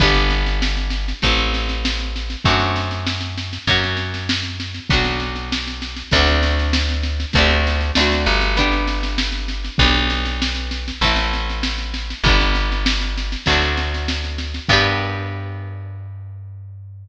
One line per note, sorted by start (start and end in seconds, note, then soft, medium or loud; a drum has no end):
0.00 1.13 G1 loud
0.00 1.20 B3 medium
0.00 1.20 D4 medium
0.00 1.20 G4 medium
0.00 kick loud
0.00 snare medium
0.14 snare medium
0.30 snare medium
0.46 snare medium
0.62 snare loud
0.77 snare medium
0.90 snare medium
1.08 snare medium
1.22 2.36 A1 medium
1.22 2.43 A3 medium
1.22 2.43 C4 medium
1.22 2.43 E4 medium
1.22 kick medium
1.22 snare medium
1.37 snare medium
1.54 snare medium
1.69 snare medium
1.85 snare loud
1.98 snare medium
2.16 snare medium
2.30 snare medium
2.45 3.58 F#2 medium
2.45 3.65 A3 medium
2.45 3.65 C4 medium
2.45 3.65 D4 medium
2.45 kick loud
2.45 snare medium
2.50 3.65 F#4 medium
2.60 snare medium
2.76 snare medium
2.91 snare medium
3.07 snare loud
3.21 snare medium
3.38 snare medium
3.53 snare medium
3.67 4.80 F#2 medium
3.67 4.87 A#3 medium
3.67 4.87 C#4 medium
3.67 4.87 F#4 medium
3.67 kick medium
3.67 snare medium
3.83 snare medium
3.97 snare medium
4.14 snare medium
4.29 snare loud
4.43 snare medium
4.60 snare medium
4.74 snare medium
4.90 6.03 B1 medium
4.90 6.10 B3 medium
4.90 6.10 D4 medium
4.90 6.10 F#4 medium
4.90 kick loud
4.90 snare medium
5.04 snare medium
5.20 snare medium
5.36 snare medium
5.52 snare loud
5.67 snare medium
5.82 snare medium
5.96 snare medium
6.11 7.25 D2 loud
6.11 7.32 A3 medium
6.11 7.32 C4 medium
6.11 7.32 D4 medium
6.11 kick loud
6.11 snare medium
6.17 7.32 F#4 medium
6.27 snare medium
6.43 snare loud
6.59 snare medium
6.73 snare loud
6.89 snare medium
7.03 snare medium
7.20 snare medium
7.33 7.92 D2 loud
7.33 7.95 A3 medium
7.33 7.95 C4 medium
7.33 kick loud
7.33 snare medium
7.38 7.95 D4 medium
7.38 7.95 G4 medium
7.50 snare medium
7.67 snare medium
7.81 snare medium
7.95 8.26 D2 medium
7.95 8.56 A3 medium
7.95 8.56 C4 medium
7.95 8.56 D4 medium
7.95 snare loud
8.01 8.56 F#4 medium
8.12 snare medium
8.26 9.70 G1 medium
8.26 snare medium
8.41 snare medium
8.57 9.77 B3 medium
8.57 9.77 D4 medium
8.57 9.77 G4 medium
8.57 kick medium
8.57 snare medium
8.72 snare medium
8.87 snare medium
9.03 snare medium
9.18 snare loud
9.32 snare medium
9.48 snare medium
9.64 snare medium
9.78 10.92 B1 loud
9.78 10.99 B3 medium
9.78 10.99 D4 medium
9.78 kick loud
9.78 snare medium
9.83 10.99 G4 medium
9.95 snare medium
10.10 snare medium
10.25 snare medium
10.42 snare loud
10.55 snare medium
10.71 snare medium
10.88 snare medium
11.01 12.14 A1 medium
11.01 12.22 A3 medium
11.01 12.22 C4 medium
11.01 12.22 E4 medium
11.01 kick medium
11.01 snare medium
11.16 snare medium
11.33 snare medium
11.49 snare medium
11.63 snare loud
11.78 snare medium
11.94 snare medium
12.10 snare medium
12.24 13.36 G1 medium
12.24 13.44 G3 medium
12.24 13.44 B3 medium
12.24 kick loud
12.24 snare medium
12.28 13.44 D4 medium
12.40 snare medium
12.55 snare medium
12.72 snare medium
12.86 snare loud
13.01 snare medium
13.17 snare medium
13.32 snare medium
13.46 14.60 D2 medium
13.46 14.67 F#3 medium
13.46 14.67 A3 medium
13.46 kick medium
13.46 snare loud
13.50 14.67 C4 medium
13.50 14.67 D4 medium
13.62 snare medium
13.77 snare medium
13.94 snare medium
14.08 snare loud
14.24 snare medium
14.38 snare medium
14.54 snare medium
14.68 17.08 G2 loud
14.68 17.08 B3 medium
14.68 17.08 D4 loud
14.68 kick loud
14.68 crash loud
14.73 17.08 G4 loud